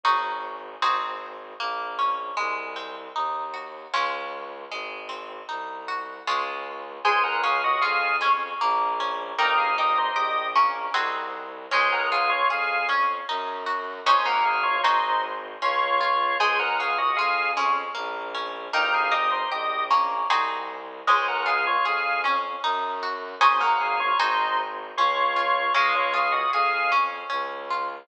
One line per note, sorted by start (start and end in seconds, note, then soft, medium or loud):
0.04 0.75 G#1 medium
0.04 0.75 C#4 medium
0.04 0.75 D#4 medium
0.04 0.75 F#4 medium
0.04 0.75 G#4 medium
0.81 1.53 G#1 medium
0.81 1.52 C4 loud
0.81 1.52 D#4 medium
0.81 1.52 F#4 loud
0.81 1.52 G#4 medium
1.59 2.31 A#1 medium
1.59 2.34 A#3 loud
1.99 2.36 C#4 medium
2.37 3.08 C2 medium
2.37 3.85 G#3 loud
2.76 3.87 C4 medium
3.15 3.86 D#2 medium
3.15 3.90 D#4 medium
3.54 3.91 F#4 medium
3.93 4.65 C#2 medium
3.93 4.64 G#3 loud
3.93 4.64 C#4 loud
3.93 4.64 F4 loud
4.71 5.41 G#1 medium
4.71 6.20 G#3 medium
5.09 6.20 C4 medium
5.49 6.19 C2 medium
5.49 6.23 D#4 medium
5.88 6.25 F#4 medium
6.27 6.99 C#2 medium
6.27 6.98 G#3 loud
6.27 6.98 C#4 medium
6.27 6.98 F4 loud
7.05 7.75 C#2 medium
7.05 8.20 G#3 loud
7.05 8.16 G#4 loud
7.05 7.23 C5 medium
7.05 7.23 G#5 medium
7.23 7.42 A#4 medium
7.23 7.42 F#5 medium
7.44 8.55 C#4 medium
7.44 7.62 G#4 medium
7.44 7.62 F5 medium
7.64 7.82 F#4 medium
7.64 7.82 D#5 medium
7.81 8.53 F2 medium
7.81 8.56 F4 medium
7.81 8.16 G#4 medium
7.81 8.16 F5 medium
8.21 8.58 G#3 medium
8.21 9.27 C#4 medium
8.61 9.33 A#1 loud
8.61 9.35 A#3 loud
9.00 9.37 C#4 medium
9.38 10.09 G1 medium
9.38 10.55 A#3 loud
9.38 10.50 D#4 loud
9.38 9.57 A#4 medium
9.38 9.57 G5 medium
9.58 9.76 G#4 medium
9.58 9.76 F5 medium
9.78 10.89 D#4 medium
9.78 9.98 G4 medium
9.78 9.98 D#5 medium
9.98 10.16 D#4 medium
9.98 10.16 C5 medium
10.16 10.87 A#1 medium
10.16 10.48 G4 medium
10.16 10.90 G4 medium
10.16 10.48 D#5 medium
10.56 10.93 A#3 medium
10.56 11.61 C#4 medium
10.94 11.66 C2 medium
10.94 11.64 C4 loud
10.94 11.64 D#4 medium
10.94 11.64 F#4 loud
10.94 11.64 G#4 loud
11.71 12.43 C#2 loud
11.71 12.83 G#3 loud
11.71 12.88 C#4 loud
11.71 11.92 C5 medium
11.71 11.92 G#5 medium
11.92 12.11 A#4 medium
11.92 12.11 F#5 medium
12.12 13.23 F4 medium
12.12 12.30 G#4 medium
12.12 12.30 F5 medium
12.30 12.48 F4 medium
12.30 12.48 C#5 medium
12.50 13.20 F2 medium
12.50 13.24 G#4 medium
12.50 12.87 G#4 medium
12.50 12.87 F5 medium
12.89 13.26 C#4 medium
12.89 13.94 C#4 medium
13.28 14.00 F#2 loud
13.28 14.03 D#4 loud
13.66 14.03 F#4 medium
14.06 14.78 G#1 medium
14.06 14.25 C#4 loud
14.06 14.77 C#4 loud
14.06 14.77 D#4 loud
14.06 14.77 F#4 loud
14.06 14.77 G#4 loud
14.06 14.26 C5 medium
14.06 14.26 G#5 medium
14.25 15.05 A#3 loud
14.25 14.44 A#4 medium
14.25 14.44 F#5 medium
14.45 14.63 G#4 medium
14.45 14.63 F5 medium
14.63 14.82 F4 medium
14.63 14.82 C#5 medium
14.83 15.56 G#1 loud
14.83 15.55 C4 loud
14.83 15.21 D#4 medium
14.83 15.55 D#4 loud
14.83 15.55 F#4 loud
14.83 15.55 G#4 loud
14.83 15.21 C5 medium
15.62 16.34 C#2 loud
15.62 16.36 C#4 loud
15.62 16.38 F4 medium
15.62 16.38 C#5 medium
16.01 16.38 F4 medium
16.40 17.10 C#2 medium
16.40 16.80 G#3 loud
16.40 17.51 G#4 loud
16.40 16.58 C5 medium
16.40 16.58 G#5 medium
16.59 16.78 A#4 medium
16.59 16.78 F#5 medium
16.79 17.19 C#4 medium
16.79 16.98 G#4 medium
16.79 16.98 F5 medium
16.98 17.17 F#4 medium
16.98 17.17 D#5 medium
17.17 17.88 F2 medium
17.17 17.58 F4 medium
17.17 17.51 G#4 medium
17.17 17.51 F5 medium
17.57 17.94 G#3 medium
17.57 18.62 C#4 medium
17.95 18.67 A#1 loud
17.95 18.34 A#3 loud
18.35 18.72 C#4 medium
18.73 19.44 G1 medium
18.73 19.12 A#3 loud
18.73 19.85 D#4 loud
18.73 18.93 A#4 medium
18.73 18.93 G5 medium
18.94 19.13 G#4 medium
18.94 19.13 F5 medium
19.12 19.50 D#4 medium
19.12 19.30 G4 medium
19.12 19.30 D#5 medium
19.31 19.50 D#4 medium
19.31 19.50 C5 medium
19.51 20.22 A#1 medium
19.51 19.84 G4 medium
19.51 19.91 G4 medium
19.51 19.84 D#5 medium
19.90 20.27 A#3 medium
19.90 20.96 C#4 medium
20.30 21.01 C2 medium
20.30 21.00 C4 loud
20.30 21.00 D#4 medium
20.30 21.00 F#4 loud
20.30 21.00 G#4 loud
21.07 21.78 C#2 loud
21.07 22.18 G#3 loud
21.07 21.47 C#4 loud
21.07 21.27 C5 medium
21.07 21.27 G#5 medium
21.28 21.47 A#4 medium
21.28 21.47 F#5 medium
21.46 21.85 F4 medium
21.46 21.65 G#4 medium
21.46 21.65 F5 medium
21.67 21.85 F4 medium
21.67 21.85 C#5 medium
21.85 22.55 F2 medium
21.85 22.21 G#4 medium
21.85 22.24 G#4 medium
21.85 22.21 F5 medium
22.24 23.29 C#4 medium
22.24 22.62 C#4 medium
22.63 23.35 F#2 loud
22.63 23.03 D#4 loud
23.03 23.40 F#4 medium
23.41 24.13 G#1 medium
23.41 24.11 C#4 loud
23.41 23.60 C#4 loud
23.41 24.11 D#4 loud
23.41 24.11 F#4 loud
23.41 24.11 G#4 loud
23.41 23.59 C5 medium
23.41 23.59 G#5 medium
23.61 24.40 A#3 loud
23.61 23.79 A#4 medium
23.61 23.79 F#5 medium
23.81 23.99 G#4 medium
23.81 23.99 F5 medium
24.00 24.18 F4 medium
24.00 24.18 C#5 medium
24.19 24.91 G#1 loud
24.19 24.90 C4 loud
24.19 24.57 D#4 medium
24.19 24.90 D#4 loud
24.19 24.90 F#4 loud
24.19 24.90 G#4 loud
24.19 24.57 C5 medium
24.97 25.69 C#2 loud
24.97 25.37 C#4 loud
24.97 25.73 F4 medium
24.97 25.73 C#5 medium
25.36 25.73 F4 medium
25.74 26.45 C#2 medium
25.74 26.86 G#3 loud
25.74 26.92 C#4 loud
25.74 25.94 G#4 medium
25.74 25.94 F5 medium
25.95 26.13 F4 medium
25.95 26.13 C#5 medium
26.14 27.25 F4 medium
26.14 26.32 G#4 medium
26.14 26.32 F5 medium
26.32 26.50 F#4 medium
26.32 26.50 D#5 medium
26.53 27.23 F2 medium
26.53 27.27 G#4 medium
26.53 26.91 G#4 medium
26.53 26.91 F5 medium
26.92 27.97 C#4 medium
26.92 27.29 C#4 medium
27.30 28.03 C#2 medium
27.30 28.04 C#4 loud
27.70 28.07 F4 medium